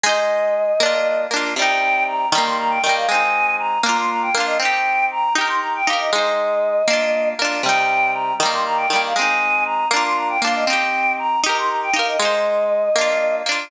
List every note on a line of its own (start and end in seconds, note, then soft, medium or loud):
0.03 0.73 G#3 medium
0.03 0.73 D#4 medium
0.03 1.21 D#5 medium
0.09 0.73 C5 medium
0.80 1.27 A#3 medium
0.80 1.27 D4 medium
0.86 1.27 F4 medium
1.31 1.54 A#3 medium
1.31 1.54 D4 medium
1.36 1.54 F4 medium
1.56 2.26 C3 medium
1.56 2.26 G3 medium
1.56 2.03 G5 loud
1.62 2.26 D#4 medium
2.07 2.28 A#5 medium
2.31 2.79 D#3 medium
2.31 2.79 G3 medium
2.31 2.43 A#5 medium
2.38 2.79 A#3 medium
2.45 2.57 C6 medium
2.59 2.71 A#5 medium
2.70 2.82 G5 medium
2.82 3.07 D#3 medium
2.82 2.94 G5 loud
2.86 3.07 G3 medium
2.86 3.07 A#3 medium
2.96 3.08 F5 medium
3.08 3.78 G#3 medium
3.08 3.78 C4 medium
3.08 3.55 G#5 medium
3.14 3.78 D#4 medium
3.59 3.81 A#5 medium
3.83 4.30 A#3 medium
3.83 4.30 D4 medium
3.83 3.97 A#5 medium
3.89 4.30 F4 medium
3.98 4.10 C6 medium
4.10 4.22 A#5 medium
4.22 4.34 G5 medium
4.33 4.58 A#3 medium
4.33 4.45 F5 medium
4.37 4.58 D4 medium
4.37 4.58 F4 medium
4.46 4.58 D#5 medium
4.60 5.29 C4 medium
4.60 5.29 D#4 medium
4.60 5.05 G5 medium
4.65 5.29 G4 medium
5.11 5.33 A#5 medium
5.35 5.82 D#4 medium
5.35 5.82 G4 medium
5.35 5.47 A#5 medium
5.41 5.82 A#4 medium
5.48 5.60 C6 medium
5.61 5.73 A#5 medium
5.75 5.87 G5 medium
5.86 6.11 D#4 medium
5.86 5.98 F5 medium
5.90 6.11 G4 medium
5.90 6.11 A#4 medium
5.99 6.11 D#5 medium
6.13 6.82 G#3 medium
6.13 6.82 D#4 medium
6.13 7.29 D#5 medium
6.18 6.82 C5 medium
6.88 7.34 A#3 medium
6.88 7.34 D4 medium
6.93 7.34 F4 medium
7.39 7.62 A#3 medium
7.39 7.62 D4 medium
7.45 7.62 F4 medium
7.63 8.33 C3 medium
7.63 8.33 G3 medium
7.63 8.11 G5 loud
7.69 8.33 D#4 medium
8.13 8.34 A#5 medium
8.38 8.86 D#3 medium
8.38 8.50 A#5 medium
8.43 8.86 G3 medium
8.43 8.86 A#3 medium
8.52 8.64 C6 medium
8.66 8.78 A#5 medium
8.77 8.88 G5 medium
8.89 9.13 D#3 medium
8.89 9.01 G5 loud
8.93 9.13 G3 medium
8.93 9.13 A#3 medium
9.04 9.16 F5 medium
9.16 9.86 G#3 medium
9.16 9.86 C4 medium
9.16 9.63 G#5 medium
9.21 9.86 D#4 medium
9.66 9.87 A#5 medium
9.91 10.37 A#3 medium
9.91 10.37 D4 medium
9.91 10.03 A#5 medium
9.96 10.37 F4 medium
10.05 10.17 C6 medium
10.16 10.28 A#5 medium
10.29 10.41 G5 medium
10.42 10.65 A#3 medium
10.42 10.65 D4 medium
10.42 10.54 F5 medium
10.47 10.65 F4 medium
10.55 10.67 D#5 medium
10.66 11.37 C4 medium
10.66 11.37 D#4 medium
10.66 11.12 G5 medium
10.73 11.37 G4 medium
11.19 11.40 A#5 medium
11.44 11.90 D#4 medium
11.44 11.90 G4 medium
11.44 11.57 A#5 medium
11.49 11.90 A#4 medium
11.58 11.70 C6 medium
11.68 11.80 A#5 medium
11.83 11.95 G5 medium
11.93 12.17 D#4 medium
11.93 12.17 G4 medium
11.93 12.07 F5 medium
11.99 12.17 A#4 medium
12.07 12.19 D#5 medium
12.19 12.89 G#3 medium
12.19 12.89 D#4 medium
12.19 13.36 D#5 medium
12.25 12.89 C5 medium
12.96 13.42 A#3 medium
12.96 13.42 D4 medium
13.01 13.42 F4 medium
13.46 13.69 A#3 medium
13.46 13.69 D4 medium
13.52 13.69 F4 medium